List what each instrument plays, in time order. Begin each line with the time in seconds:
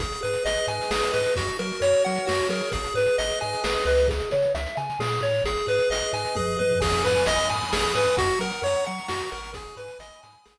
0.00 synth bass 1 G#1, lead 1 (square) G#4, kick, closed hi-hat
0.12 closed hi-hat
0.23 synth bass 1 G#2, lead 1 (square) B4, closed hi-hat
0.33 closed hi-hat
0.44 synth bass 1 G#1, lead 1 (square) D#5, closed hi-hat
0.57 closed hi-hat
0.67 synth bass 1 G#2, lead 1 (square) G#4 G#5, closed hi-hat
0.81 closed hi-hat
0.90 synth bass 1 G#1, lead 1 (square) G#4 B4, snare
1.02 closed hi-hat
1.12 synth bass 1 G#2, lead 1 (square) B4 D#5, closed hi-hat
1.26 closed hi-hat
1.36 synth bass 1 F#2, lead 1 (square) F#4, kick, closed hi-hat
1.47 closed hi-hat
1.59 synth bass 1 F#3, lead 1 (square) A#4, closed hi-hat
1.72 closed hi-hat
1.81 synth bass 1 F#2, lead 1 (square) C#5, closed hi-hat
1.93 closed hi-hat
2.05 synth bass 1 F#3, lead 1 (square) F#4 F#5, closed hi-hat
2.15 closed hi-hat
2.27 synth bass 1 F#2, lead 1 (square) F#4 A#4, snare
2.39 closed hi-hat
2.49 synth bass 1 F#3, lead 1 (square) G#4 A#4, closed hi-hat
2.62 closed hi-hat
2.72 synth bass 1 G#1, lead 1 (square) G#4, kick, closed hi-hat
2.84 closed hi-hat
2.94 synth bass 1 G#2, lead 1 (square) B4, closed hi-hat
3.06 closed hi-hat
3.18 synth bass 1 G#1, lead 1 (square) D#5, closed hi-hat
3.30 closed hi-hat
3.40 synth bass 1 G#2, lead 1 (square) G#4 G#5, closed hi-hat
3.53 closed hi-hat
3.64 synth bass 1 G#1, lead 1 (square) G#4 B4, snare
3.74 closed hi-hat
3.85 synth bass 1 C#2, lead 1 (square) B4 D#5, closed hi-hat
3.97 closed hi-hat
4.08 lead 1 (square) G#4, kick, closed hi-hat
4.20 closed hi-hat
4.31 synth bass 1 C#3, lead 1 (square) C#5, closed hi-hat
4.42 closed hi-hat
4.54 synth bass 1 C#2, lead 1 (square) E5, closed hi-hat
4.66 closed hi-hat
4.77 synth bass 1 C#3, lead 1 (square) G#5, closed hi-hat
4.90 closed hi-hat
4.99 synth bass 1 A#2, lead 1 (square) G#4, snare
5.12 closed hi-hat
5.21 synth bass 1 A2, lead 1 (square) C#5, closed hi-hat
5.34 closed hi-hat
5.44 synth bass 1 G#1, lead 1 (square) G#4, kick, closed hi-hat
5.57 closed hi-hat
5.67 synth bass 1 G#2, lead 1 (square) B4, closed hi-hat
5.79 closed hi-hat
5.90 synth bass 1 G#1, lead 1 (square) D#5, closed hi-hat
6.03 closed hi-hat
6.13 synth bass 1 G#2, lead 1 (square) G#4 G#5, closed hi-hat
6.25 closed hi-hat
6.35 synth bass 1 F#2, lead 1 (square) G#4 B4, kick, high tom
6.57 synth bass 1 G2, lead 1 (square) B4 D#5, high tom
6.71 floor tom
6.80 synth bass 1 G#1, lead 1 (square) G#4 G#5, kick, crash
6.93 closed hi-hat
7.05 synth bass 1 G#2, lead 1 (square) B4 B5, closed hi-hat
7.15 closed hi-hat
7.26 synth bass 1 G#1, lead 1 (square) D#5 D#6, closed hi-hat
7.39 closed hi-hat
7.50 synth bass 1 G#2, lead 1 (square) G#5, closed hi-hat
7.61 closed hi-hat
7.73 synth bass 1 G#1, lead 1 (square) G#4 B5, snare
7.84 closed hi-hat
7.93 synth bass 1 G#2, lead 1 (square) B4 D#6, closed hi-hat
8.05 closed hi-hat
8.17 synth bass 1 F#2, lead 1 (square) F#4 F#5, kick, closed hi-hat
8.29 closed hi-hat
8.39 synth bass 1 F#3, lead 1 (square) A#4 A#5, closed hi-hat
8.51 closed hi-hat
8.62 synth bass 1 F#2, lead 1 (square) C#5 C#6, closed hi-hat
8.76 closed hi-hat
8.85 synth bass 1 F#3, lead 1 (square) F#5, closed hi-hat
8.98 closed hi-hat
9.08 synth bass 1 F#2, lead 1 (square) F#4 A#5, snare
9.20 closed hi-hat
9.31 synth bass 1 G#1, lead 1 (square) A#4 C#6, closed hi-hat
9.44 closed hi-hat
9.54 lead 1 (square) G#4 G#5, kick, closed hi-hat
9.67 closed hi-hat
9.76 synth bass 1 G#2, lead 1 (square) B4 B5, closed hi-hat
9.88 closed hi-hat
9.99 synth bass 1 G#1, lead 1 (square) D#5 D#6, closed hi-hat
10.12 closed hi-hat
10.23 synth bass 1 G#2, lead 1 (square) G#5, closed hi-hat
10.33 closed hi-hat
10.45 synth bass 1 G#1, lead 1 (square) G#4 B5, snare
10.57 closed hi-hat